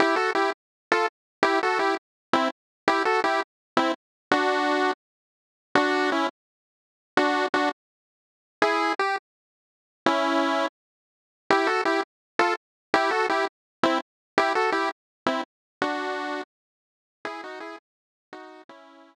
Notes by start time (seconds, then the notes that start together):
0.00 E4 G4
0.16 F#4 A4
0.35 E4 G4
0.92 F4 A4
1.43 E4 G4
1.63 F#4 A4
1.79 E4 G4
2.33 C4 E4
2.88 E4 G4
3.05 F#4 A4
3.24 E4 G4
3.77 C4 E4
4.32 D4 F#4
5.75 D4 F#4
6.12 C#4 E4
7.17 D4 F#4
7.54 D4 F#4
8.62 E4 G#4
8.99 G4
10.06 C#4 E4
11.50 E4 G4
11.67 F#4 A4
11.85 E4 G4
12.39 F4 A4
12.94 E4 G4
13.11 F#4 A4
13.29 E4 G4
13.83 C4 E4
14.38 E4 G4
14.55 F#4 A4
14.72 E4 G4
15.26 C4 E4
15.82 D4 F#4
17.25 E4 G#4
17.44 D#4 F#4
17.60 E4 G#4
18.33 D#4 F#4
18.69 C#4 E4